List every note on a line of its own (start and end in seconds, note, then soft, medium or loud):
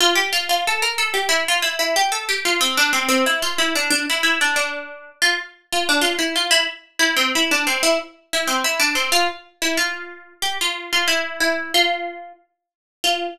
0.01 0.16 F4 loud
0.15 0.31 G4 loud
0.33 0.48 F4 loud
0.49 0.65 F4 medium
0.67 0.83 A4 medium
0.82 0.98 A#4 medium
0.98 1.14 A4 medium
1.14 1.29 G4 medium
1.29 1.44 E4 loud
1.48 1.64 F4 loud
1.62 1.78 E4 medium
1.79 1.95 E4 medium
1.96 2.12 G4 loud
2.12 2.27 A4 loud
2.29 2.44 G4 loud
2.45 2.61 F4 medium
2.61 2.76 C4 loud
2.77 2.93 D4 loud
2.93 3.08 C4 medium
3.09 3.24 C4 loud
3.26 3.42 E4 medium
3.42 3.58 F4 loud
3.58 3.74 E4 medium
3.75 3.90 D4 loud
3.90 4.06 D4 loud
4.10 4.23 E4 medium
4.23 4.39 E4 medium
4.41 4.56 D4 medium
4.56 5.10 D4 medium
5.22 5.37 F4 loud
5.72 5.88 F4 medium
5.89 6.04 D4 loud
6.01 6.17 F4 loud
6.19 6.34 E4 medium
6.36 6.51 F4 medium
6.51 6.66 E4 loud
6.99 7.15 E4 loud
7.17 7.32 C4 medium
7.35 7.51 E4 medium
7.51 7.67 D4 medium
7.67 7.82 C4 medium
7.83 7.98 E4 loud
8.33 8.49 E4 loud
8.47 8.63 C4 medium
8.64 8.80 E4 loud
8.80 8.95 D4 loud
8.95 9.11 C4 medium
9.12 9.27 F4 loud
9.62 9.77 E4 medium
9.77 10.33 F4 medium
10.42 10.58 G4 loud
10.61 10.91 F4 loud
10.93 11.08 F4 medium
11.08 11.39 E4 loud
11.40 11.72 E4 medium
11.74 12.33 F4 loud
13.04 13.27 F4 loud